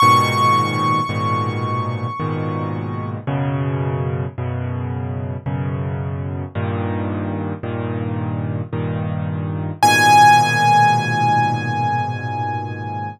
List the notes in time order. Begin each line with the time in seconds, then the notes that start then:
0.00 G#2 A#2 B2 D#3 C#6
1.09 G#2 A#2 B2 D#3
2.20 G#2 A#2 B2 D#3
3.27 F#2 B2 C#3
4.38 F#2 B2 C#3
5.46 F#2 B2 C#3
6.55 G2 A#2 D#3
7.63 G2 A#2 D#3
8.73 G2 A#2 D#3
9.82 G#2 A#2 B2 D#3 G#5